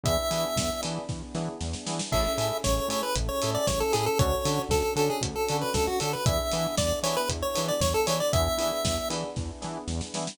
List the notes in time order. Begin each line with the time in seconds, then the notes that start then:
0.04 E2 B3 D4 E4 G#4 E5, kick, closed hi-hat
0.30 E3 B3 D4 E4 G#4, open hi-hat
0.56 E2, kick, snare
0.83 E3 B3 D4 E4 G#4, open hi-hat
1.09 E2, kick, snare
1.35 E3 B3 D4 E4 G#4, snare
1.61 E2, snare
1.73 snare
1.86 E3 B3 D4 E4 G#4, snare
1.99 snare
2.12 A1 C#4 E4 G#4 A4 E5, kick, crash
2.38 A2 C#4 E4 G#4 A4, open hi-hat
2.64 A1 C#5, kick, snare
2.88 A2 C#4 E4 G#4 A4 C#5, open hi-hat
3.03 B4
3.16 A1, kick, closed hi-hat
3.29 C#5
3.42 A2 C#4 E4 G#4 A4, open hi-hat
3.55 D5
3.67 A1 C#5, kick, snare
3.80 A4
3.92 A2 C#4 E4 G#4 A4, open hi-hat
4.06 A4
4.18 D2 C#4 D4 F#4 A4 C#5, kick, closed hi-hat
4.45 D3 C#4 D4 F#4 A4, open hi-hat
4.69 D2 A4, kick, snare
4.96 D3 C#4 D4 F#4 A4, open hi-hat
5.10 G#4
5.21 D2, kick, closed hi-hat
5.36 A4
5.48 D3 C#4 D4 F#4 A4, open hi-hat
5.61 B4
5.74 D2 A4, kick, snare
5.87 F#4
6.00 D3 C#4 D4 F#4 A4, open hi-hat
6.13 B4
6.26 E2 B3 D4 E4 G#4 E5, kick, closed hi-hat
6.52 E3 B3 D4 E4 G#4, open hi-hat
6.77 E2 D5, kick, snare
7.03 E3 B3 D4 E4 G#4 C#5, open hi-hat
7.17 B4
7.29 E2, kick, closed hi-hat
7.42 C#5
7.55 E3 B3 D4 E4 G#4, open hi-hat
7.68 D5
7.81 E2 C#5, kick, snare
7.94 A4
8.06 E3 B3 D4 E4 G#4 C#5, open hi-hat
8.20 D5
8.33 E2 B3 D4 E4 G#4 E5, kick, closed hi-hat
8.58 E3 B3 D4 E4 G#4, open hi-hat
8.84 E2, kick, snare
9.10 E3 B3 D4 E4 G#4, open hi-hat
9.36 E2, kick, snare
9.62 E3 B3 D4 E4 G#4, snare
9.88 E2, snare
10.01 snare
10.14 E3 B3 D4 E4 G#4, snare
10.27 snare